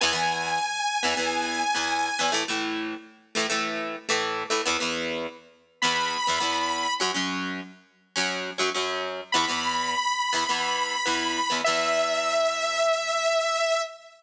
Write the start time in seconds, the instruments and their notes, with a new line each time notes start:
0.01 acoustic guitar (steel) E2 E3 B3, lead 2 (sawtooth) G#5
0.13 acoustic guitar (steel) E2 E3 B3
1.03 acoustic guitar (steel) E2 E3 B3
1.17 acoustic guitar (steel) E2 E3 B3
1.75 acoustic guitar (steel) E2 E3 B3
2.19 acoustic guitar (steel) E2 E3 B3
2.32 acoustic guitar (steel) A2 E3 A3
2.48 acoustic guitar (steel) A2 E3 A3
3.35 acoustic guitar (steel) A2 E3 A3
3.50 acoustic guitar (steel) A2 E3 A3
4.09 acoustic guitar (steel) A2 E3 A3
4.50 acoustic guitar (steel) A2 E3 A3
4.66 acoustic guitar (steel) E2 E3 B3
4.80 acoustic guitar (steel) E2 E3 B3
5.82 acoustic guitar (steel) E2 E3 B3, lead 2 (sawtooth) B5
6.27 acoustic guitar (steel) E2 E3 B3
6.40 acoustic guitar (steel) E2 E3 B3
7.00 acoustic guitar (steel) F#2 F#3 C#4
7.14 acoustic guitar (steel) F#2 F#3 C#4
8.16 acoustic guitar (steel) F#2 F#3 C#4
8.58 acoustic guitar (steel) F#2 F#3 C#4
8.75 acoustic guitar (steel) F#2 F#3 C#4
9.32 acoustic guitar (steel) E2 E3 B3, lead 2 (sawtooth) B5
9.48 acoustic guitar (steel) E2 E3 B3
10.33 acoustic guitar (steel) E2 E3 B3
10.49 acoustic guitar (steel) E2 E3 B3
11.06 acoustic guitar (steel) E2 E3 B3
11.50 acoustic guitar (steel) E2 E3 B3
11.64 acoustic guitar (steel) E2 E3 B3, lead 2 (sawtooth) E5